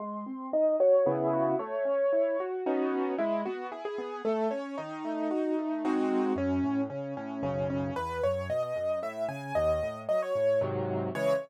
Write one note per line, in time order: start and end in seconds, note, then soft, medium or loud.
0.00 0.24 G#3 loud
0.00 0.46 C6 medium
0.26 0.50 C4 medium
0.53 0.77 D#4 medium
0.53 0.76 D#5 medium
0.80 1.04 F#4 medium
0.80 1.06 C#5 medium
1.06 1.54 C#3 loud
1.06 1.54 B3 loud
1.06 1.54 E4 loud
1.06 1.29 G#4 medium
1.33 1.56 F#4 medium
1.59 1.84 A3 loud
1.59 2.48 C#5 medium
1.85 2.09 C#4 medium
2.13 2.37 E4 medium
2.40 2.64 F#4 medium
2.66 3.14 B3 loud
2.66 3.14 C#4 loud
2.66 3.14 D#4 loud
2.66 3.14 F#4 medium
3.18 3.43 G#3 loud
3.18 3.41 E4 medium
3.45 3.70 B3 medium
3.45 3.67 F#4 medium
3.72 3.96 E4 medium
3.72 3.84 G#4 medium
3.85 4.22 G#4 medium
3.98 4.22 B3 medium
4.25 4.49 A3 loud
4.25 4.48 A4 medium
4.51 4.75 C#4 medium
4.51 4.75 C#5 medium
4.78 5.03 D#3 loud
4.78 5.98 D#4 medium
5.05 5.29 A3 medium
5.31 5.55 F#4 medium
5.59 5.83 A3 medium
5.85 6.33 G#3 loud
5.85 6.33 C4 loud
5.85 6.33 D#4 medium
5.85 6.33 F#4 loud
6.36 6.60 F#2 loud
6.36 6.81 C#4 medium
6.64 6.87 A2 medium
6.90 7.14 C#3 medium
6.90 7.14 C#4 medium
7.17 7.41 A2 medium
7.17 7.42 C#4 medium
7.43 7.90 B1 medium
7.43 7.90 F#2 medium
7.43 7.90 C#3 loud
7.43 7.67 C#4 medium
7.70 7.94 C#4 medium
7.96 8.20 E2 loud
7.96 8.22 B4 medium
8.23 8.48 F#2 medium
8.23 8.48 C#5 medium
8.49 8.73 B2 medium
8.49 8.62 D#5 medium
8.63 8.99 D#5 medium
8.76 9.00 F#2 medium
9.02 9.26 A2 medium
9.02 9.25 E5 medium
9.29 9.53 C#3 medium
9.29 9.54 G#5 medium
9.55 9.80 D#2 loud
9.55 9.98 D#5 medium
9.83 10.07 A2 medium
10.09 10.33 F#3 medium
10.09 10.21 D#5 medium
10.22 10.60 C#5 medium
10.35 10.59 A2 medium
10.61 11.09 G#2 loud
10.61 11.09 C3 loud
10.61 11.09 D#3 medium
10.61 11.09 F#3 loud
11.15 11.34 C#3 loud
11.15 11.34 E3 loud
11.15 11.34 G#3 loud
11.15 11.34 C#5 loud